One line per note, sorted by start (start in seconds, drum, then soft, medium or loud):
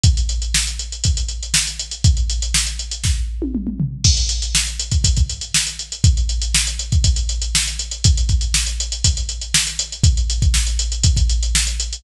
0.03 kick medium
0.03 closed hi-hat medium
0.17 closed hi-hat medium
0.29 closed hi-hat medium
0.42 closed hi-hat medium
0.54 snare medium
0.67 closed hi-hat medium
0.79 closed hi-hat medium
0.92 closed hi-hat medium
1.04 kick medium
1.04 closed hi-hat medium
1.17 closed hi-hat medium
1.28 closed hi-hat medium
1.43 closed hi-hat medium
1.54 snare loud
1.67 closed hi-hat medium
1.79 closed hi-hat medium
1.91 closed hi-hat medium
2.04 kick medium
2.04 closed hi-hat medium
2.17 closed hi-hat medium
2.29 closed hi-hat medium
2.42 closed hi-hat medium
2.54 snare medium
2.67 closed hi-hat medium
2.79 closed hi-hat medium
2.91 closed hi-hat medium
3.04 kick medium
3.04 snare medium
3.42 high tom medium
3.55 mid tom medium
3.67 mid tom medium
3.80 floor tom medium
4.04 kick medium
4.04 crash loud
4.17 closed hi-hat medium
4.29 closed hi-hat medium
4.42 closed hi-hat medium
4.55 snare medium
4.67 closed hi-hat soft
4.79 closed hi-hat medium
4.91 kick medium
4.91 closed hi-hat medium
5.04 kick medium
5.04 closed hi-hat medium
5.16 kick medium
5.16 closed hi-hat medium
5.29 closed hi-hat medium
5.41 closed hi-hat medium
5.54 snare medium
5.67 closed hi-hat medium
5.79 closed hi-hat medium
5.92 closed hi-hat medium
6.04 kick medium
6.04 closed hi-hat medium
6.17 closed hi-hat medium
6.29 closed hi-hat medium
6.42 closed hi-hat medium
6.54 snare loud
6.67 closed hi-hat medium
6.79 closed hi-hat medium
6.92 kick medium
6.92 closed hi-hat medium
7.04 kick medium
7.04 closed hi-hat medium
7.16 closed hi-hat medium
7.29 closed hi-hat medium
7.42 closed hi-hat medium
7.55 snare loud
7.67 closed hi-hat medium
7.79 closed hi-hat medium
7.91 closed hi-hat medium
8.04 kick medium
8.04 closed hi-hat medium
8.17 closed hi-hat medium
8.29 kick medium
8.29 closed hi-hat medium
8.41 closed hi-hat medium
8.54 snare medium
8.66 closed hi-hat medium
8.80 closed hi-hat medium
8.92 closed hi-hat medium
9.04 kick medium
9.04 closed hi-hat loud
9.17 closed hi-hat medium
9.29 closed hi-hat medium
9.41 closed hi-hat medium
9.54 snare loud
9.67 closed hi-hat medium
9.79 closed hi-hat medium
9.92 closed hi-hat medium
10.03 kick medium
10.03 closed hi-hat medium
10.17 closed hi-hat medium
10.30 closed hi-hat medium
10.42 kick medium
10.42 closed hi-hat medium
10.54 snare medium
10.67 closed hi-hat medium
10.79 closed hi-hat medium
10.92 closed hi-hat medium
11.03 kick medium
11.03 closed hi-hat medium
11.16 kick medium
11.16 closed hi-hat medium
11.29 closed hi-hat medium
11.43 closed hi-hat medium
11.55 snare medium
11.67 closed hi-hat medium
11.80 closed hi-hat medium
11.93 closed hi-hat medium